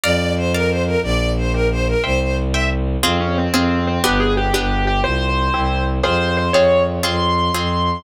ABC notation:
X:1
M:6/8
L:1/8
Q:3/8=120
K:F
V:1 name="Acoustic Grand Piano"
z6 | z6 | z6 | [K:Fm] C D C C2 C |
G A G G2 G | c6 | c2 c d2 z | c'6 |]
V:2 name="Violin"
d2 c B c B | d2 c B c B | c c z e z2 | [K:Fm] z6 |
z6 | z6 | z6 | z6 |]
V:3 name="Orchestral Harp"
[dfb]3 [dfb]3 | [dgb]3 [dgb]3 | [ceg]3 [ceg]3 | [K:Fm] [CFA]3 [CFA]3 |
[=B,=DG]3 [B,DG]3 | [CFG]3 [C=EG]3 | [CFA]3 [CFA]3 | [CFA]3 [CFA]3 |]
V:4 name="Violin" clef=bass
F,,6 | B,,,6 | C,,6 | [K:Fm] F,,3 F,,3 |
G,,,3 G,,,3 | C,,3 C,,3 | F,,3 F,,3 | F,,3 F,,3 |]